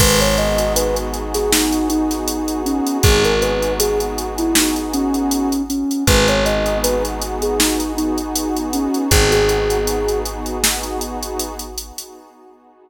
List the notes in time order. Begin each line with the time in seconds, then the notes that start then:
0.00 G#1 B3 D#4 F#4 G#4 B4, kick, crash
0.21 C#5, closed hi-hat
0.38 D#5, closed hi-hat
0.58 closed hi-hat
0.76 B4, closed hi-hat
0.96 closed hi-hat
1.14 closed hi-hat
1.34 G#4, snare, closed hi-hat
1.52 D#4, snare
1.72 closed hi-hat
1.90 D#4, closed hi-hat
2.11 snare, closed hi-hat
2.28 closed hi-hat
2.48 closed hi-hat
2.66 C#4, closed hi-hat
2.87 closed hi-hat
3.03 G#1 G#4, kick, closed hi-hat
3.25 A#4, closed hi-hat
3.42 B4, closed hi-hat
3.63 closed hi-hat
3.80 G#4, closed hi-hat
4.00 closed hi-hat
4.18 closed hi-hat
4.38 E4, closed hi-hat
4.55 D#4, snare
4.76 closed hi-hat
4.94 C#4, closed hi-hat
5.14 closed hi-hat
5.31 closed hi-hat
5.52 closed hi-hat
5.70 C#4, closed hi-hat
5.91 closed hi-hat
6.07 G#1 B3 D#4 F#4 G#4 B4, kick, closed hi-hat
6.28 C#5, closed hi-hat
6.46 D#5, closed hi-hat
6.66 closed hi-hat
6.83 B4, closed hi-hat
7.05 closed hi-hat
7.22 closed hi-hat
7.42 G#4, closed hi-hat
7.59 D#4, snare
7.80 closed hi-hat
7.97 D#4, closed hi-hat
8.18 closed hi-hat
8.35 closed hi-hat
8.56 closed hi-hat
8.73 C#4, closed hi-hat
8.94 closed hi-hat
9.11 G#1 G#4, kick, closed hi-hat
9.32 G#4, snare, closed hi-hat
9.49 G#4, closed hi-hat
9.70 closed hi-hat
9.87 closed hi-hat
10.08 closed hi-hat
10.25 closed hi-hat
10.46 closed hi-hat
10.64 snare
10.83 closed hi-hat
11.01 closed hi-hat
11.23 closed hi-hat
11.40 closed hi-hat
11.59 closed hi-hat
11.78 closed hi-hat
11.98 closed hi-hat